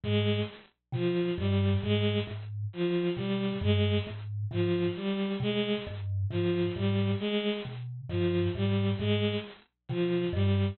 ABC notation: X:1
M:6/4
L:1/8
Q:1/4=67
K:none
V:1 name="Kalimba" clef=bass
_A,, z B,, G,, A,, A,, z B,, G,, A,, A,, z | B,, G,, _A,, A,, z B,, G,, A,, A,, z B,, G,, |]
V:2 name="Violin" clef=bass
_A, z F, G, A, z F, G, A, z F, G, | _A, z F, G, A, z F, G, A, z F, G, |]